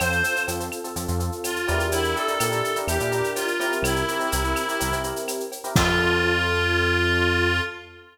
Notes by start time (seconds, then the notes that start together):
0.00 F2 C4 F4 A4 C5, cowbell, claves, shaker
0.12 shaker
0.24 C4 F4 A4, shaker
0.36 C4 F4 A4, shaker
0.48 F2 C4 F4 A4, cowbell, shaker
0.60 C4 F4 A4, shaker
0.72 claves, shaker
0.84 C4 F4 A4, shaker
0.96 F2 C4 F4 A4, cowbell, shaker
1.08 F2 C4 F4 A4, shaker
1.20 C4 F4 A4, shaker
1.32 shaker
1.44 F4, cowbell, claves, shaker
1.56 shaker
1.68 E2 D4 E4 G4 A#4, cowbell, shaker
1.80 shaker
1.92 E4, cowbell, shaker
2.04 shaker
2.16 D4 E4 G4 A4 A#4, shaker
2.28 D4 E4 G4 A#4, shaker
2.40 A#2 D4 E4 G4 A#4, cowbell, claves, shaker
2.52 D4 E4 G4 A#4, shaker
2.64 shaker
2.76 D4 E4 G4 A#4, shaker
2.87 E2 D4 E4 G4 A#4, cowbell, claves, shaker
3.00 A#2 D4 E4 G4 A#4, shaker
3.12 D4 E4 G4 A#4, shaker
3.24 shaker
3.35 F4, cowbell, shaker
3.48 shaker
3.60 C4 E4 G4 A#4, cowbell, shaker
3.72 shaker
3.82 C2 E4, cowbell, claves, shaker
3.96 shaker
4.08 C4 E4 G4 A#4, shaker
4.19 C4 E4 G4 A#4, shaker
4.32 C2 C4 E4 G4 A#4, cowbell, shaker
4.44 C4 E4 G4 A#4, shaker
4.56 claves, shaker
4.68 C4 E4 G4 A#4, shaker
4.80 C2 C4 E4 G4 A#4, cowbell, shaker
4.91 C2 C4 E4 G4 A#4, shaker
5.04 C4 E4 G4 A#4, shaker
5.16 shaker
5.28 cowbell, claves, shaker
5.40 shaker
5.52 cowbell, shaker
5.64 C4 E4 G4 A#4, shaker
5.76 F2 C4 F4 A4, kick, crash